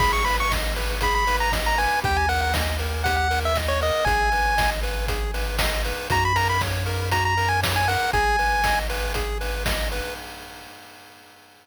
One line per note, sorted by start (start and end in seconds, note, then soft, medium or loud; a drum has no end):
0.00 1.88 G#1 medium
0.00 0.23 G#4 loud
0.00 0.12 B5 loud
0.00 kick loud
0.00 crash loud
0.13 0.25 C#6 medium
0.25 0.48 B4 medium
0.25 0.37 B5 medium
0.25 open hi-hat medium
0.40 0.52 C#6 loud
0.51 0.74 D#5 medium
0.51 kick medium
0.51 snare loud
0.76 0.99 B4 medium
0.76 open hi-hat medium
1.01 1.25 G#4 loud
1.01 1.14 B5 medium
1.01 kick medium
1.01 closed hi-hat loud
1.15 1.37 B5 loud
1.27 1.50 B4 loud
1.27 open hi-hat medium
1.40 1.52 A#5 medium
1.52 1.75 D#5 medium
1.52 kick medium
1.52 snare loud
1.66 1.78 A#5 medium
1.78 2.01 B4 medium
1.78 2.00 G#5 loud
1.78 open hi-hat medium
2.03 3.91 D#2 medium
2.03 2.26 G4 loud
2.03 2.17 G5 loud
2.03 kick loud
2.03 closed hi-hat medium
2.17 2.29 G#5 medium
2.29 2.52 A#4 medium
2.29 2.41 F#5 loud
2.29 open hi-hat medium
2.41 2.53 F#5 medium
2.54 2.77 D#5 medium
2.54 kick medium
2.54 snare loud
2.79 3.03 A#4 medium
2.79 open hi-hat medium
3.04 3.28 G4 medium
3.04 3.16 F#5 loud
3.04 kick medium
3.04 closed hi-hat loud
3.17 3.40 F#5 medium
3.31 3.53 A#4 medium
3.31 open hi-hat medium
3.45 3.57 E5 medium
3.55 3.79 D#5 medium
3.55 kick medium
3.55 snare medium
3.68 3.80 C#5 medium
3.81 4.04 A#4 medium
3.81 4.05 D#5 medium
3.81 open hi-hat medium
4.05 5.93 G#1 medium
4.05 4.30 G#4 loud
4.05 4.70 G#5 loud
4.05 kick loud
4.05 closed hi-hat medium
4.32 4.55 B4 medium
4.32 open hi-hat medium
4.58 4.81 D#5 medium
4.58 kick medium
4.58 snare loud
4.83 5.06 B4 medium
4.83 open hi-hat medium
5.08 5.31 G#4 medium
5.08 kick medium
5.08 closed hi-hat loud
5.34 5.57 B4 medium
5.34 open hi-hat medium
5.58 5.82 D#5 medium
5.58 kick medium
5.58 snare loud
5.85 6.08 B4 medium
5.85 open hi-hat medium
6.10 7.97 F#2 medium
6.10 6.33 F#4 loud
6.10 6.24 A#5 loud
6.10 kick loud
6.10 closed hi-hat loud
6.25 6.37 B5 loud
6.36 6.58 A#4 medium
6.36 6.48 A#5 loud
6.36 open hi-hat medium
6.49 6.62 B5 medium
6.61 6.84 C#5 medium
6.61 kick medium
6.61 snare medium
6.86 7.09 A#4 medium
6.86 open hi-hat medium
7.11 7.35 F#4 medium
7.11 7.24 A#5 medium
7.11 kick medium
7.11 closed hi-hat loud
7.25 7.49 A#5 medium
7.37 7.60 A#4 medium
7.37 open hi-hat medium
7.49 7.61 G#5 medium
7.63 7.86 C#5 medium
7.63 kick medium
7.63 snare loud
7.76 7.88 G#5 loud
7.88 8.11 A#4 medium
7.88 8.11 F#5 medium
7.88 open hi-hat medium
8.13 10.01 G#1 medium
8.13 8.36 G#4 loud
8.13 8.79 G#5 loud
8.13 kick loud
8.13 closed hi-hat medium
8.39 8.62 B4 medium
8.39 open hi-hat medium
8.64 8.87 D#5 medium
8.64 kick medium
8.64 snare loud
8.90 9.13 B4 medium
8.90 open hi-hat medium
9.14 9.38 G#4 medium
9.14 kick medium
9.14 closed hi-hat loud
9.41 9.64 B4 medium
9.41 open hi-hat medium
9.66 9.89 D#5 medium
9.66 kick medium
9.66 snare loud
9.92 10.14 B4 medium
9.92 open hi-hat medium